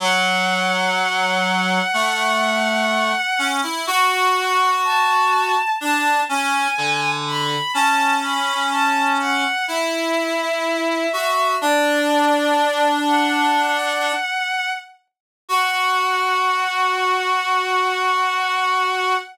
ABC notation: X:1
M:4/4
L:1/16
Q:1/4=62
K:F#m
V:1 name="Violin"
f16 | f4 a4 a2 g4 b2 | a2 b2 a2 f2 e8 | d6 f8 z2 |
f16 |]
V:2 name="Clarinet"
F,8 A,6 C E | F8 D2 C2 D,4 | C8 E6 F2 | D12 z4 |
F16 |]